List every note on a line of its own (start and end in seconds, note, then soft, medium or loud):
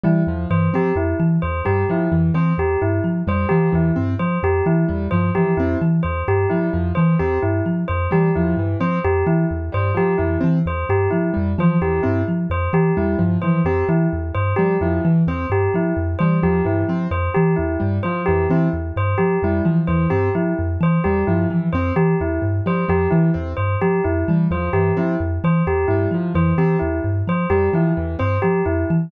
0.04 0.24 E3 medium
0.04 0.22 G3 medium
0.04 0.23 E4 medium
0.27 0.45 E2 medium
0.27 0.47 F3 medium
0.50 0.69 G2 medium
0.50 0.69 E3 medium
0.50 0.69 C5 medium
0.73 0.92 F3 medium
0.73 0.92 C4 medium
0.73 0.94 G4 medium
0.95 1.14 F2 medium
0.95 1.15 E4 medium
1.20 1.38 E3 medium
1.42 1.62 E2 medium
1.42 1.61 C5 medium
1.65 1.85 G2 medium
1.65 1.84 G3 medium
1.65 1.84 G4 medium
1.89 2.08 F3 medium
1.89 2.09 E4 medium
2.12 2.31 F2 medium
2.12 2.30 E3 medium
2.34 2.53 E3 medium
2.34 2.53 C4 medium
2.34 2.53 C5 medium
2.58 2.76 E2 medium
2.58 2.77 G4 medium
2.82 3.00 G2 medium
2.82 3.00 E4 medium
3.04 3.22 F3 medium
3.27 3.45 F2 medium
3.27 3.46 G3 medium
3.27 3.47 C5 medium
3.49 3.69 E3 medium
3.49 3.70 F3 medium
3.49 3.67 G4 medium
3.72 3.92 E2 medium
3.72 3.91 E3 medium
3.72 3.94 E4 medium
3.96 4.15 G2 medium
3.96 4.14 C4 medium
4.19 4.38 F3 medium
4.19 4.38 C5 medium
4.43 4.61 F2 medium
4.43 4.62 G4 medium
4.66 4.84 E3 medium
4.66 4.85 E4 medium
4.88 5.08 E2 medium
4.88 5.07 G3 medium
5.11 5.31 G2 medium
5.11 5.31 F3 medium
5.11 5.29 C5 medium
5.35 5.55 E3 medium
5.35 5.54 F3 medium
5.35 5.53 G4 medium
5.57 5.75 F2 medium
5.57 5.78 C4 medium
5.57 5.76 E4 medium
5.81 6.00 E3 medium
6.03 6.23 E2 medium
6.03 6.21 C5 medium
6.28 6.46 G2 medium
6.28 6.47 G4 medium
6.50 6.69 F3 medium
6.50 6.69 G3 medium
6.50 6.68 E4 medium
6.73 6.92 F2 medium
6.73 6.92 F3 medium
6.95 7.15 E3 medium
6.95 7.17 E3 medium
6.95 7.13 C5 medium
7.19 7.38 E2 medium
7.19 7.38 C4 medium
7.19 7.38 G4 medium
7.42 7.61 G2 medium
7.42 7.61 E4 medium
7.66 7.84 F3 medium
7.88 8.07 F2 medium
7.88 8.06 C5 medium
8.11 8.31 E3 medium
8.11 8.29 G3 medium
8.11 8.31 G4 medium
8.35 8.54 E2 medium
8.35 8.55 F3 medium
8.35 8.54 E4 medium
8.57 8.75 G2 medium
8.57 8.77 E3 medium
8.80 8.99 F3 medium
8.80 8.99 C4 medium
8.80 8.99 C5 medium
9.04 9.23 F2 medium
9.04 9.23 G4 medium
9.26 9.45 E3 medium
9.26 9.45 E4 medium
9.51 9.69 E2 medium
9.72 9.92 G2 medium
9.72 9.91 G3 medium
9.72 9.93 C5 medium
9.94 10.13 F3 medium
9.94 10.16 F3 medium
9.94 10.16 G4 medium
10.18 10.37 F2 medium
10.18 10.37 E3 medium
10.18 10.36 E4 medium
10.41 10.62 E3 medium
10.41 10.59 C4 medium
10.66 10.84 E2 medium
10.66 10.86 C5 medium
10.89 11.08 G2 medium
10.89 11.08 G4 medium
11.11 11.31 F3 medium
11.11 11.29 E4 medium
11.34 11.55 F2 medium
11.34 11.52 G3 medium
11.58 11.77 E3 medium
11.58 11.77 F3 medium
11.58 11.79 C5 medium
11.81 12.00 E2 medium
11.81 12.00 E3 medium
11.81 12.00 G4 medium
12.03 12.23 G2 medium
12.03 12.22 C4 medium
12.03 12.21 E4 medium
12.28 12.47 F3 medium
12.50 12.68 F2 medium
12.50 12.70 C5 medium
12.73 12.91 E3 medium
12.73 12.92 G4 medium
12.97 13.15 E2 medium
12.97 13.15 G3 medium
12.97 13.16 E4 medium
13.19 13.37 G2 medium
13.19 13.37 F3 medium
13.42 13.62 E3 medium
13.42 13.61 F3 medium
13.42 13.60 C5 medium
13.65 13.83 F2 medium
13.65 13.85 C4 medium
13.65 13.84 G4 medium
13.89 14.07 E3 medium
13.89 14.07 E4 medium
14.13 14.31 E2 medium
14.35 14.53 G2 medium
14.35 14.53 C5 medium
14.56 14.77 F3 medium
14.56 14.77 G3 medium
14.56 14.75 G4 medium
14.81 14.99 F2 medium
14.81 15.01 F3 medium
14.81 15.00 E4 medium
15.05 15.23 E3 medium
15.27 15.45 E2 medium
15.27 15.46 C4 medium
15.27 15.47 C5 medium
15.50 15.68 G2 medium
15.50 15.70 G4 medium
15.74 15.93 F3 medium
15.74 15.94 E4 medium
15.97 16.15 F2 medium
16.19 16.39 E3 medium
16.19 16.39 G3 medium
16.19 16.37 C5 medium
16.43 16.62 E2 medium
16.43 16.61 F3 medium
16.43 16.62 G4 medium
16.64 16.84 G2 medium
16.64 16.83 E3 medium
16.64 16.85 E4 medium
16.88 17.07 F3 medium
16.88 17.08 C4 medium
17.11 17.29 F2 medium
17.11 17.30 C5 medium
17.34 17.55 E3 medium
17.34 17.53 G4 medium
17.56 17.77 E2 medium
17.56 17.75 E4 medium
17.80 18.00 G2 medium
17.80 17.98 G3 medium
18.03 18.23 F3 medium
18.03 18.21 C5 medium
18.26 18.47 F2 medium
18.26 18.46 E3 medium
18.26 18.44 G4 medium
18.49 18.68 E3 medium
18.49 18.69 C4 medium
18.49 18.69 E4 medium
18.73 18.91 E2 medium
18.96 19.15 G2 medium
18.96 19.16 C5 medium
19.18 19.37 F3 medium
19.18 19.36 G4 medium
19.42 19.61 F2 medium
19.42 19.62 G3 medium
19.42 19.62 E4 medium
19.65 19.84 E3 medium
19.65 19.83 F3 medium
19.87 20.07 E2 medium
19.87 20.07 E3 medium
19.87 20.06 C5 medium
20.10 20.30 G2 medium
20.10 20.29 C4 medium
20.10 20.29 G4 medium
20.35 20.53 F3 medium
20.35 20.53 E4 medium
20.59 20.77 F2 medium
20.80 20.99 E3 medium
20.80 21.01 C5 medium
21.04 21.23 E2 medium
21.04 21.24 G3 medium
21.04 21.23 G4 medium
21.27 21.46 G2 medium
21.27 21.47 F3 medium
21.27 21.46 E4 medium
21.50 21.69 E3 medium
21.50 21.69 F3 medium
21.73 21.91 F2 medium
21.73 21.93 C4 medium
21.73 21.91 C5 medium
21.96 22.15 E3 medium
21.96 22.15 G4 medium
22.20 22.39 E2 medium
22.20 22.40 E4 medium
22.42 22.60 G2 medium
22.66 22.84 F3 medium
22.66 22.85 G3 medium
22.66 22.86 C5 medium
22.88 23.07 F2 medium
22.88 23.07 F3 medium
22.88 23.08 G4 medium
23.11 23.30 E3 medium
23.11 23.31 E3 medium
23.11 23.29 E4 medium
23.34 23.54 E2 medium
23.34 23.52 C4 medium
23.57 23.76 G2 medium
23.57 23.75 C5 medium
23.82 24.00 F3 medium
23.82 24.00 G4 medium
24.04 24.24 F2 medium
24.04 24.23 E4 medium
24.28 24.47 E3 medium
24.28 24.48 G3 medium
24.51 24.69 E2 medium
24.51 24.69 F3 medium
24.51 24.70 C5 medium
24.73 24.92 G2 medium
24.73 24.92 E3 medium
24.73 24.92 G4 medium
24.97 25.16 F3 medium
24.97 25.15 C4 medium
24.97 25.16 E4 medium
25.20 25.38 F2 medium
25.44 25.62 E3 medium
25.44 25.63 C5 medium
25.67 25.85 E2 medium
25.67 25.86 G4 medium
25.88 26.07 G2 medium
25.88 26.09 G3 medium
25.88 26.06 E4 medium
26.11 26.29 F3 medium
26.11 26.33 F3 medium
26.35 26.53 F2 medium
26.35 26.53 E3 medium
26.35 26.54 C5 medium
26.58 26.76 E3 medium
26.58 26.77 C4 medium
26.58 26.77 G4 medium
26.79 27.00 E2 medium
26.79 26.98 E4 medium
27.04 27.22 G2 medium
27.27 27.46 F3 medium
27.27 27.47 C5 medium
27.50 27.68 F2 medium
27.50 27.69 G3 medium
27.50 27.68 G4 medium
27.73 27.92 E3 medium
27.73 27.92 F3 medium
27.73 27.93 E4 medium
27.97 28.16 E2 medium
27.97 28.15 E3 medium
28.19 28.39 G2 medium
28.19 28.37 C4 medium
28.19 28.38 C5 medium
28.42 28.62 F3 medium
28.42 28.61 G4 medium
28.66 28.84 F2 medium
28.66 28.84 E4 medium
28.90 29.09 E3 medium